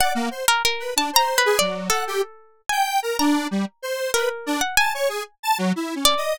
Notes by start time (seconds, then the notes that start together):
0.00 D5 F#5
0.15 A#3
0.31 C5
0.48 A#4
0.65 A#4
0.80 B4
0.96 D4 A5
1.13 C5 A#5
1.38 B4
1.45 G#4
1.59 F#3 D5
1.90 A4 F#5
2.07 G4
2.69 G5 G#5
3.03 A#4
3.19 D4 A#5
3.51 G3
3.82 C5
4.14 A#4 B4
4.46 D4
4.61 F#5
4.77 G#5 A5
4.94 C#5
5.09 G#4
5.43 A5
5.58 F#3
5.76 E4
5.95 C#4
6.05 D5
6.17 D#5